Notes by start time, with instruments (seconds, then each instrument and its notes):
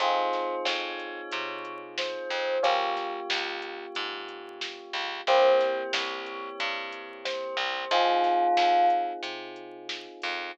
0.00 electric bass (finger) F2, electric piano 1 C4 D#4 F4 G#4, tubular bells C5, kick, closed hi-hat
0.33 kick, snare, closed hi-hat
0.65 electric bass (finger) F2, tubular bells C#5, snare
0.99 closed hi-hat
1.31 electric bass (finger) C3, kick, closed hi-hat
1.65 kick, closed hi-hat
1.98 tubular bells C5, snare
2.30 electric bass (finger) F2, closed hi-hat
2.63 electric bass (finger) C#2, electric piano 1 A#3 C#4 F4 G4, tubular bells C#5, kick, closed hi-hat
2.97 kick, snare, closed hi-hat
3.30 electric bass (finger) C#2, snare
3.62 closed hi-hat
3.95 electric bass (finger) G#2, kick, closed hi-hat
4.29 closed hi-hat
4.61 snare
4.93 electric bass (finger) C#2, closed hi-hat
5.27 electric bass (finger) C2, electric piano 1 A#3 C4 E4 G4, tubular bells C5, kick, closed hi-hat
5.60 kick, snare, closed hi-hat
5.93 electric bass (finger) C2, tubular bells C#5, snare
6.26 closed hi-hat
6.60 electric bass (finger) G2, kick, closed hi-hat
6.92 kick, closed hi-hat
7.25 tubular bells C5, snare
7.57 electric bass (finger) C2, closed hi-hat
7.91 electric bass (finger) F2, electric piano 1 C4 D#4 F4 G#4, tubular bells F4, kick, closed hi-hat
8.24 kick, snare, closed hi-hat
8.57 electric bass (finger) F2, snare
8.90 closed hi-hat
9.23 electric bass (finger) C3, kick, closed hi-hat
9.56 closed hi-hat
9.89 snare
10.22 electric bass (finger) F2, closed hi-hat